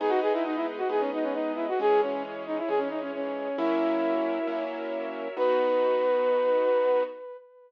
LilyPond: <<
  \new Staff \with { instrumentName = "Flute" } { \time 4/4 \key b \major \tempo 4 = 134 gis'16 fis'16 gis'16 e'16 dis'16 e'16 r16 fis'16 gis'16 cis'16 dis'16 cis'16 dis'8 e'16 fis'16 | gis'8 cis'8 r8 dis'16 e'16 gis'16 cis'16 dis'16 cis'16 cis'4 | e'2~ e'8 r4. | b'1 | }
  \new Staff \with { instrumentName = "Acoustic Grand Piano" } { \time 4/4 \key b \major <gis b dis'>2 <gis b dis'>2 | <e gis cis'>2 <e gis cis'>2 | <fis ais cis' e'>2 <fis ais cis' e'>2 | <b dis' fis'>1 | }
  \new Staff \with { instrumentName = "String Ensemble 1" } { \time 4/4 \key b \major <gis' b' dis''>1 | <e' gis' cis''>1 | <fis' ais' cis'' e''>1 | <b dis' fis'>1 | }
>>